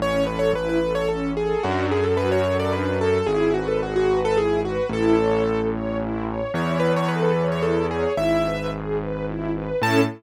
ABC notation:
X:1
M:3/4
L:1/16
Q:1/4=110
K:A
V:1 name="Acoustic Grand Piano"
c2 B c B B2 c A2 G2 | F2 G A B c2 d B2 A2 | G2 F A F F2 A G2 F2 | A6 z6 |
c2 B c B B2 c A2 G2 | e4 z8 | a4 z8 |]
V:2 name="String Ensemble 1"
C2 A2 E2 A2 C2 A2 | D2 A2 F2 A2 D2 A2 | E2 B2 G2 B2 E2 B2 | E2 c2 A2 c2 E2 c2 |
E2 c2 A2 c2 E2 c2 | E2 B2 G2 B2 E2 B2 | [CEA]4 z8 |]
V:3 name="Acoustic Grand Piano" clef=bass
A,,,4 A,,,8 | F,,4 F,,8 | G,,,12 | A,,,12 |
E,,12 | G,,,12 | A,,4 z8 |]